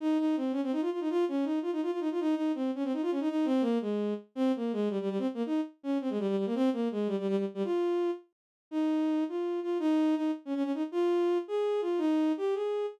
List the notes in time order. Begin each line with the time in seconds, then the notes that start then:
0.00 D#4
0.18 D#4
0.37 C4
0.52 C#4
0.63 C4
0.72 D#4
0.81 F4
0.92 F4
1.01 D#4
1.10 F4
1.28 C#4
1.45 D#4
1.62 F4
1.72 D#4
1.82 F4
1.91 F4
2.00 D#4
2.11 F4
2.20 D#4
2.35 D#4
2.55 C4
2.75 C#4
2.84 C4
2.93 D#4
3.02 F4
3.11 C#4
3.20 D#4
3.29 D#4
3.45 C4
3.61 A#3
3.81 G#3
4.35 C4
4.56 A#3
4.73 G#3
4.90 G3
5.01 G3
5.10 G3
5.19 C4
5.34 A#3
5.46 D#4
5.83 C#4
6.01 C4
6.10 G#3
6.19 G3
6.28 G3
6.37 G3
6.46 A#3
6.55 C4
6.73 A#3
6.91 G#3
7.07 G3
7.19 G3
7.28 G3
7.37 G3
7.54 G3
7.64 F4
8.71 D#4
9.29 F4
9.63 F4
9.79 D#4
10.16 D#4
10.45 C#4
10.55 C#4
10.64 C#4
10.74 D#4
10.92 F4
11.48 G#4
11.81 F4
11.98 D#4
12.37 G4
12.55 G#4